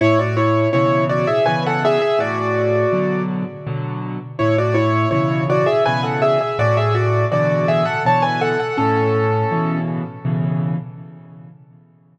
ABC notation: X:1
M:3/4
L:1/16
Q:1/4=82
K:A
V:1 name="Acoustic Grand Piano"
[Ec] [Fd] [Ec]2 [Ec]2 [Fd] [Ge] [Bg] [Af] [Ge] [Ge] | [Fd]6 z6 | [Ec] [Fd] [Ec]2 [Ec]2 [Fd] [Ge] [Bg] [Af] [Ge] [Ge] | [Fd] [Ge] [Fd]2 [Fd]2 [Ge] [Af] [ca] [Bg] [Af] [Af] |
[CA]6 z6 |]
V:2 name="Acoustic Grand Piano" clef=bass
A,,4 [B,,C,E,]4 [B,,C,E,]4 | A,,4 [B,,D,F,]4 [B,,D,F,]4 | A,,4 [B,,C,E,]4 [B,,C,E,]4 | A,,4 [B,,D,E,]4 [B,,D,E,]4 |
A,,4 [B,,C,E,]4 [B,,C,E,]4 |]